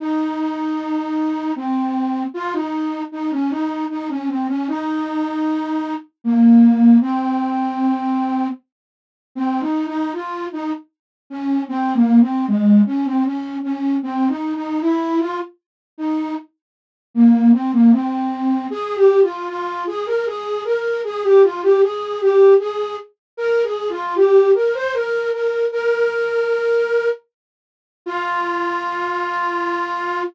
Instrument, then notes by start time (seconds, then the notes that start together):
flute
0.00 D#4
1.56 C4
2.34 F4
2.53 D#4
3.12 D#4
3.31 C#4
3.50 D#4
3.90 D#4
4.09 C#4
4.28 C4
4.48 C#4
4.68 D#4
6.24 A#3
7.01 C4
9.35 C4
9.61 D#4
9.87 D#4
10.13 F4
10.52 D#4
11.30 C#4
11.69 C4
11.94 A#3
12.21 C4
12.47 G#3
12.86 C#4
13.05 C4
13.25 C#4
13.63 C#4
14.03 C4
14.28 D#4
14.55 D#4
14.81 E4
15.20 F4
15.98 D#4
17.14 A#3
17.53 C4
17.73 A#3
17.92 C4
18.70 G#4
18.96 G4
19.22 F4
19.48 F4
19.87 G#4
20.06 A#4
20.26 G#4
20.65 A#4
21.04 G#4
21.23 G4
21.43 F4
21.63 G4
21.82 G#4
22.21 G4
22.59 G#4
23.37 A#4
23.64 G#4
23.89 F4
24.15 G4
24.55 A#4
24.74 C5
24.93 A#4
25.33 A#4
25.72 A#4
28.06 F4